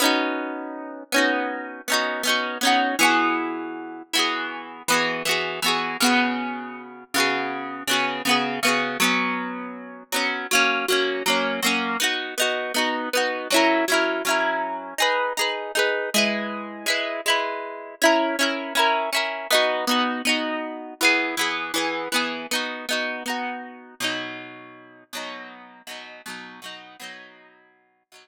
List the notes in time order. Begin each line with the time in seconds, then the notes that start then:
0.00 B3 C#4 D#4
0.05 F#4
1.12 B3 C#4 D#4
1.18 F#4
1.88 B3 C#4 D#4
1.93 F#4
2.23 B3 C#4 D#4
2.29 F#4
2.61 B3 C#4 D#4
2.67 F#4
2.99 E3 B3 F#4
3.04 G#4
4.13 E3 B3 F#4
4.19 G#4
4.88 E3 B3 F#4
4.94 G#4
5.25 E3 B3 F#4
5.31 G#4
5.62 E3 B3 F#4
5.68 G#4
6.00 C#3 B3 F#4
6.06 G#4
7.14 C#3 B3 F#4
7.20 G#4
7.88 C#3 B3 F#4
7.93 G#4
8.25 C#3 B3 F#4
8.31 G#4
8.63 C#3 B3 F#4
8.68 G#4
9.00 F#3 B3 C#4
10.12 F#3 B3 C#4
10.51 F#3 A#3 C#4
10.88 F#3 A#3 C#4
11.26 F#3 A#3 C#4
11.62 F#3 A#3 C#4
12.00 B3 D#4 F#4
12.38 B3 D#4 F#4
12.74 B3 D#4 F#4
13.13 B3 D#4 F#4
13.50 F#3 C#4 E4
13.56 A#4
13.88 F#3 C#4 E4
13.94 A#4
14.25 F#3 C#4 E4
14.30 A#4
14.98 D#4 G#4 B4
15.37 D#4 G#4 B4
15.75 D#4 G#4 B4
16.14 G#3 E4 B4
16.86 G#3 E4 B4
17.26 G#3 E4 B4
18.02 C#4 E4 A#4
18.39 C#4 E4 A#4
18.75 C#4 E4 A#4
19.13 C#4 E4 A#4
19.50 B3 D#4 F#4
19.87 B3 D#4 F#4
20.25 B3 D#4 F#4
21.01 E3 B3 G#4
21.37 E3 B3 G#4
21.74 E3 B3 G#4
22.12 E3 B3 G#4
22.51 B3 D#4 F#4
22.89 B3 D#4 F#4
23.26 B3 D#4 F#4
24.00 B2 F#3 D#4
25.13 B2 F#3 D#4
25.87 B2 F#3 D#4
26.26 B2 F#3 D#4
26.62 B2 F#3 D#4
27.00 B2 F#3 D#4
28.12 B2 F#3 D#4